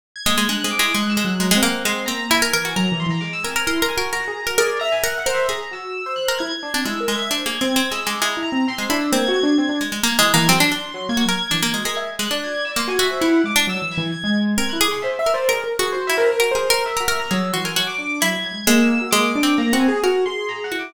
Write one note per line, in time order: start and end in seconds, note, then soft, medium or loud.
0.16 0.25 G#6 medium
0.26 0.36 G#3 loud
0.26 0.47 A#3 medium
0.26 0.46 G#6 medium
0.38 0.48 G#3 medium
0.49 0.63 G#3 medium
0.49 0.63 D4 soft
0.49 0.71 F#6 medium
0.64 0.78 G#3 medium
0.64 0.77 C4 medium
0.71 0.81 D6 loud
0.79 0.93 G#3 medium
0.79 0.93 E4 medium
0.79 0.93 D6 medium
0.95 1.15 G#3 medium
0.95 1.22 G#3 medium
0.95 1.09 F#6 medium
1.09 1.23 E6 medium
1.17 1.37 G#3 medium
1.24 1.52 F#3 medium
1.24 1.38 F#6 medium
1.40 1.50 G#3 medium
1.40 1.51 A#5 soft
1.51 1.61 G#3 loud
1.51 1.82 F#5 medium
1.55 1.83 C4 medium
1.63 1.83 A#3 loud
1.85 2.06 G#3 medium
1.85 2.06 C4 medium
1.85 2.07 C6 medium
2.06 2.49 A#3 medium
2.06 2.28 C4 medium
2.06 2.26 A#5 loud
2.30 2.41 E4 loud
2.30 2.71 G#5 loud
2.42 2.52 A#4 loud
2.53 2.74 E3 medium
2.53 2.64 A#4 loud
2.65 2.75 F#4 medium
2.76 2.90 F#3 medium
2.76 3.38 A#4 medium
2.76 2.96 A#5 loud
2.92 3.06 E3 loud
3.00 3.10 C6 medium
3.07 3.20 E3 medium
3.07 3.21 A#5 medium
3.21 3.42 G#3 medium
3.21 3.31 D6 medium
3.33 3.43 E6 loud
3.43 3.65 C4 medium
3.43 3.55 A#4 medium
3.43 3.64 G#5 medium
3.56 3.66 A#4 medium
3.66 3.81 E4 medium
3.66 3.81 A#4 medium
3.66 3.87 C6 medium
3.82 3.96 D4 medium
3.82 3.96 A#4 loud
3.88 4.09 G#5 medium
3.97 4.11 F#4 loud
3.97 4.11 A#4 medium
4.13 4.27 F#4 loud
4.13 4.43 A#4 medium
4.13 4.54 A#5 medium
4.28 4.41 G#4 medium
4.43 4.57 F#4 medium
4.43 4.57 A#4 medium
4.58 4.79 G#4 loud
4.58 4.78 A#4 loud
4.58 4.78 D5 medium
4.79 5.01 E5 loud
4.79 4.90 A#5 loud
4.92 5.02 G#5 loud
5.03 5.14 A#4 loud
5.03 5.24 E5 medium
5.03 5.17 F#5 medium
5.18 5.31 F#5 loud
5.26 5.47 A#4 medium
5.26 5.46 C5 loud
5.34 5.48 E5 medium
5.48 6.10 G#4 medium
5.48 5.60 G#4 medium
5.48 5.69 A#5 medium
5.71 6.02 F#4 soft
5.71 6.14 E6 medium
6.06 6.37 C5 medium
6.16 6.36 F#6 medium
6.28 6.39 A#4 medium
6.38 6.50 E4 medium
6.38 6.79 G#6 medium
6.63 6.73 D4 medium
6.74 6.84 C4 medium
6.74 6.84 D4 medium
6.85 7.06 G#3 medium
6.85 6.99 E4 medium
6.85 7.05 E6 medium
7.00 7.14 A#4 medium
7.08 7.29 G#3 medium
7.08 7.29 G#6 loud
7.15 7.29 E5 medium
7.31 7.44 D4 medium
7.31 7.44 C5 medium
7.31 7.62 G#6 medium
7.46 7.60 A#3 medium
7.46 7.59 G#4 medium
7.61 7.75 C4 medium
7.61 7.75 C4 loud
7.66 7.74 G#6 loud
7.75 7.90 C4 medium
7.75 7.88 G#6 medium
7.91 8.05 G#3 soft
7.91 8.05 E6 loud
8.06 8.20 G#3 medium
8.06 8.20 D6 medium
8.20 8.42 G#3 medium
8.20 8.35 E4 medium
8.20 8.41 A#5 medium
8.37 8.51 E4 medium
8.43 8.63 A#5 loud
8.52 8.66 C4 medium
8.68 8.88 C4 loud
8.68 8.82 C6 loud
8.78 8.89 G#3 medium
8.82 8.96 C6 medium
8.90 9.10 D4 loud
8.90 9.00 E4 medium
8.98 9.11 E6 medium
9.12 9.26 A#3 loud
9.12 9.74 C4 medium
9.12 9.33 G#6 medium
9.28 9.42 F#4 loud
9.34 9.44 G#6 loud
9.43 9.57 D4 loud
9.47 9.57 G#6 medium
9.58 9.68 C4 loud
9.58 9.78 G#6 medium
9.69 9.79 D4 medium
9.81 9.91 G#3 medium
9.92 10.02 G#3 medium
10.03 10.17 A#3 medium
10.03 10.17 A#3 loud
10.03 10.19 G#6 medium
10.19 10.32 E3 loud
10.19 10.32 G#3 loud
10.19 10.34 F#6 medium
10.34 10.47 E3 loud
10.34 10.47 A#3 loud
10.34 10.48 G#6 medium
10.48 10.59 F#3 medium
10.48 10.59 C4 loud
10.48 10.89 C6 loud
10.60 10.71 D4 loud
10.72 10.92 D4 medium
10.94 11.08 F#3 loud
10.94 11.09 C6 medium
11.09 11.23 A#3 loud
11.09 11.23 G#6 loud
11.17 11.27 F#4 medium
11.24 11.39 F#3 medium
11.24 11.37 G#6 loud
11.29 11.39 A#4 medium
11.41 11.82 G#6 loud
11.51 11.62 E3 medium
11.51 11.61 D4 medium
11.62 11.73 A#3 medium
11.74 11.84 G#3 medium
11.74 11.84 F#4 medium
11.84 12.16 G#3 medium
11.84 11.96 A#4 medium
11.84 12.05 G#6 soft
11.97 12.07 E5 medium
12.19 12.29 G#3 medium
12.19 12.29 F#6 medium
12.30 12.72 D4 medium
12.30 12.72 D5 medium
12.30 12.41 F#6 medium
12.44 12.54 G#6 medium
12.54 12.65 G#6 medium
12.65 12.75 E6 medium
12.76 12.97 A#3 medium
12.76 12.88 C6 medium
12.88 13.08 F#4 medium
12.88 12.99 G#5 loud
12.99 13.20 F#4 loud
12.99 13.19 E5 loud
13.11 13.21 C5 medium
13.21 13.42 E4 loud
13.21 13.52 E4 medium
13.21 13.41 F#5 medium
13.44 13.65 G#3 medium
13.44 13.66 D6 medium
13.56 13.66 D4 loud
13.67 13.81 F#3 loud
13.67 13.90 E6 loud
13.82 13.96 E3 medium
13.91 14.12 G#6 medium
13.98 14.11 E3 loud
14.12 14.22 G#6 medium
14.24 14.54 G#3 medium
14.24 14.35 G#6 medium
14.58 14.71 C4 medium
14.58 14.78 A#4 medium
14.58 14.70 G#6 medium
14.69 14.87 E4 medium
14.69 14.79 F#6 medium
14.81 15.22 G#4 loud
14.81 14.91 D6 medium
14.88 15.02 G#4 medium
14.88 15.01 C6 medium
15.02 15.18 C5 medium
15.02 15.16 E5 medium
15.19 15.33 E5 loud
15.19 15.33 E5 medium
15.26 15.47 A#4 medium
15.34 15.48 C5 loud
15.34 15.48 D5 medium
15.48 15.63 G#4 medium
15.48 15.69 A#4 medium
15.48 15.76 A#4 medium
15.64 15.77 A#4 medium
15.79 16.07 F#4 loud
15.79 15.93 G#4 medium
15.92 16.15 F#4 medium
15.92 16.03 C5 loud
16.07 16.37 E4 medium
16.07 16.17 E5 loud
16.17 16.38 A#4 loud
16.17 16.27 C5 medium
16.30 16.38 A#4 medium
16.39 16.50 F#4 medium
16.39 16.53 A#4 medium
16.51 16.69 G#4 medium
16.51 16.82 C5 loud
16.55 16.69 A#4 loud
16.70 16.84 A#4 loud
16.70 16.84 A#4 medium
16.85 16.98 A#4 medium
16.85 17.16 E5 medium
16.97 17.14 F#4 medium
16.97 17.07 A#4 medium
17.08 17.29 A#4 loud
17.15 17.29 A#3 medium
17.20 17.30 A#5 loud
17.30 17.52 F#3 loud
17.30 17.51 G#4 medium
17.30 17.51 E6 medium
17.53 17.74 E3 medium
17.53 17.64 F#4 medium
17.53 17.63 C6 medium
17.64 17.75 A#4 medium
17.64 17.75 G#5 medium
17.76 17.97 F#3 medium
17.76 18.17 F#4 loud
17.76 17.86 F#5 medium
17.87 18.18 D6 loud
17.98 18.19 D4 medium
18.21 18.36 F#3 medium
18.21 18.63 E4 loud
18.21 18.41 G#6 medium
18.36 18.50 F#3 medium
18.44 18.54 G#6 medium
18.52 18.65 G#3 soft
18.52 18.64 G#6 medium
18.67 19.08 G#3 loud
18.67 18.98 A#3 loud
18.67 19.08 E6 loud
19.01 19.12 F#4 medium
19.11 19.40 G#3 loud
19.11 19.33 A#3 medium
19.11 19.52 D6 loud
19.35 19.56 D4 loud
19.43 19.70 C4 medium
19.58 19.72 A#3 loud
19.58 19.78 A#5 medium
19.73 19.86 C4 loud
19.73 20.00 F#4 medium
19.80 20.00 G#5 medium
19.88 20.02 G#4 loud
20.04 20.24 F#4 loud
20.04 20.65 A#4 medium
20.26 20.67 G#4 medium
20.26 20.46 C6 medium
20.49 20.62 A#5 medium
20.64 20.78 F#5 medium
20.72 20.92 E4 medium
20.72 20.92 F#4 soft
20.79 20.92 D6 medium